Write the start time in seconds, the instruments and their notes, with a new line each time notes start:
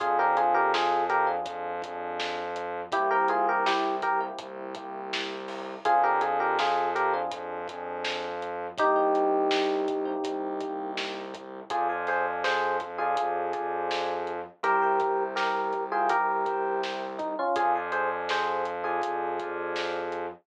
0.00 synth bass 2 F2, electric piano 1 C4 D4 F4 G#4, kick, closed hi-hat
0.19 electric piano 1 C4 D4 F4 G4 G#4 A#4
0.37 electric piano 1 F4 G#4, closed hi-hat
0.54 electric piano 1 G4 A#4
0.74 electric piano 1 F4 G#4, snare
1.10 electric piano 1 G4 A#4, closed hi-hat
1.27 electric piano 1 C4 D4 F4 G#4
1.46 synth bass 2 F2, kick, closed hi-hat
1.82 electric piano 1 C4 D4 F4 G#4, kick, closed hi-hat
2.20 snare
2.56 closed hi-hat
2.92 synth bass 2 C2, electric piano 1 A#3 C4 E4 G4, kick, closed hi-hat
3.11 electric piano 1 A#3 C4 E4 G4 A#4
3.28 electric piano 1 F4 G#4, closed hi-hat
3.49 electric piano 1 G4 A#4
3.66 electric piano 1 E4 G4, snare
4.02 electric piano 1 G4 A#4, kick, closed hi-hat
4.20 electric piano 1 A#3 C4 E4 G4
4.39 synth bass 2 C2, kick, closed hi-hat
4.75 electric piano 1 A#3 C4 E4 G4, kick, closed hi-hat
5.13 snare
5.48 snare, open hi-hat
5.85 synth bass 2 F2, electric piano 1 C4 D4 F4 G#4, kick, closed hi-hat
6.03 electric piano 1 C4 D4 F4 G4 G#4 A#4
6.21 electric piano 1 F4 G#4, closed hi-hat
6.40 electric piano 1 G4 A#4
6.59 electric piano 1 F4 G#4, snare
6.95 electric piano 1 G4 A#4, closed hi-hat
7.14 electric piano 1 C4 D4 F4 G#4
7.31 synth bass 2 F2, kick, closed hi-hat
7.68 electric piano 1 C4 D4 F4 G#4, kick, closed hi-hat
8.05 snare
8.42 closed hi-hat
8.78 synth bass 2 C2, electric piano 1 A#3 C4 D#4 G4, kick, closed hi-hat
8.96 electric piano 1 A#3 C4 D#4 G4
9.15 closed hi-hat
9.51 snare
9.88 kick, closed hi-hat
10.05 electric piano 1 A#3 C4 D#4 G4
10.24 synth bass 2 C2, kick, closed hi-hat
10.61 electric piano 1 A#3 C4 D#4 G4, kick, closed hi-hat
10.97 snare
11.34 kick, closed hi-hat
11.70 synth bass 2 F2, electric piano 1 F4 G#4 C5 D5 F5 G#5, kick, closed hi-hat
11.89 electric piano 1 C5 D5 F5 G#5
12.07 electric piano 1 G#4 C5, snare, closed hi-hat
12.44 electric piano 1 G#4 C5, snare
12.80 kick, closed hi-hat
12.98 electric piano 1 F4 G#4 C5 D5 F5 G#5
13.17 kick, closed hi-hat
13.53 electric piano 1 C5 D5 F5 G#5, kick, closed hi-hat
13.91 snare
14.27 closed hi-hat
14.63 synth bass 2 C2, electric piano 1 G4 A#4 C5 E5 G5, closed hi-hat
14.82 electric piano 1 A#4 C5 E5 G5
15.00 kick, closed hi-hat
15.36 electric piano 1 G4 A#4, snare
15.73 kick, closed hi-hat
15.92 electric piano 1 F4 G#4 A#4 C5 E5 G5
16.09 electric piano 1 G4 A#4, kick, closed hi-hat
16.46 electric piano 1 A#4 C5 E5 G5, kick, closed hi-hat
16.83 snare
17.18 electric piano 1 D#4, kick, closed hi-hat
17.39 electric piano 1 C#4 F4
17.56 synth bass 2 F2, electric piano 1 F4 G#4 C5 D5 F5 G#5, kick, closed hi-hat
17.75 electric piano 1 C5 D5 F5 G#5
17.92 electric piano 1 G#4 C5, closed hi-hat
18.29 electric piano 1 G#4 C5, snare, closed hi-hat
18.65 closed hi-hat
18.84 electric piano 1 F4 G#4 C5 D5 F5 G#5
19.02 kick, closed hi-hat
19.39 electric piano 1 C5 D5 F5 G#5, kick, closed hi-hat
19.76 snare
20.12 closed hi-hat